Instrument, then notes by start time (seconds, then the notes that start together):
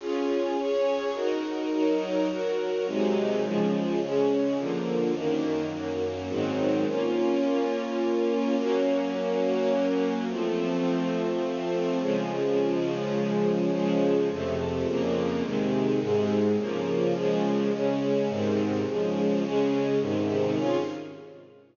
string ensemble 1
0.00 C#4 F4 G#4
0.57 C#4 G#4 C#5
1.14 D#4 F#4 A#4
1.71 F#3 D#4 A#4
2.29 F#3 F#4 A#4
2.86 C3 F#3 G#3 D#4
3.43 C#3 F3 G#3
4.01 C#3 G#3 C#4
4.57 D3 F3 A#3
5.14 F#2 D#3 A#3
5.71 F#2 F#3 A#3
6.28 G#2 D#3 F#3 C4
6.86 A#3 C#4 F4
8.58 F#3 A#3 C#4
10.28 F3 A3 C4
12.00 C#3 F3 G#3
13.72 C#3 F3 G#3
14.29 F2 C3 A3
14.86 F2 C#3 A#3
15.42 C3 D#3 G#3
16.00 G#2 C3 G#3
16.57 C#3 F3 A#3
17.14 C#3 F3 G#3
17.71 C#3 G#3 C#4
18.28 G#2 C3 D#3
18.86 C#3 F3 G#3
19.43 C#3 G#3 C#4
20.00 G#2 C3 D#3
20.56 C#4 F4 G#4